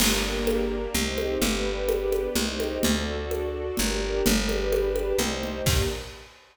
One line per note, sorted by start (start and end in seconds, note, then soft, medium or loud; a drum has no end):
0.00 0.88 G1 loud
0.00 0.94 A#3 medium
0.00 0.94 D4 medium
0.00 0.94 G4 medium
0.00 0.94 A#4 medium
0.00 0.94 D5 medium
0.00 crash loud
0.00 low conga loud
0.47 high conga loud
0.94 1.38 C2 loud
0.94 1.41 C4 medium
0.94 1.41 D#4 medium
0.94 1.41 G4 medium
0.94 1.42 C5 medium
0.94 1.42 D#5 medium
0.94 low conga medium
1.18 high conga medium
1.41 2.29 G1 loud
1.41 2.35 B3 medium
1.41 2.35 D4 medium
1.41 2.35 G4 medium
1.41 2.35 B4 medium
1.41 2.35 D5 medium
1.41 low conga loud
1.89 high conga loud
2.12 high conga medium
2.35 2.79 C2 loud
2.35 2.83 C4 medium
2.35 2.83 D#4 medium
2.35 2.83 G4 medium
2.35 2.83 C5 medium
2.35 2.83 D#5 medium
2.35 low conga loud
2.60 high conga medium
2.83 3.71 D2 loud
2.83 3.77 D4 medium
2.83 3.77 F#4 medium
2.83 3.77 A4 medium
2.83 3.77 D5 medium
2.83 low conga loud
3.31 high conga medium
3.77 4.22 G1 loud
3.77 4.25 D4 medium
3.77 4.25 G4 medium
3.77 4.25 A#4 medium
3.77 4.25 D5 medium
3.77 low conga medium
4.25 5.13 G1 loud
4.25 5.19 D4 medium
4.25 5.19 G4 medium
4.25 5.19 B4 medium
4.25 5.20 B4 medium
4.25 5.20 D5 medium
4.25 low conga loud
4.49 high conga medium
4.72 high conga loud
4.96 high conga medium
5.19 5.62 C2 loud
5.19 5.67 D#4 medium
5.19 5.66 G4 medium
5.19 5.66 C5 medium
5.19 5.67 C5 medium
5.19 5.66 D#5 medium
5.19 low conga medium
5.43 low conga medium
5.66 5.83 G2 loud
5.66 5.83 A#3 loud
5.66 5.83 D4 loud
5.66 5.83 G4 loud
5.66 5.85 G4 medium
5.66 5.85 A#4 loud
5.66 5.85 D5 loud
5.66 kick loud
5.66 crash loud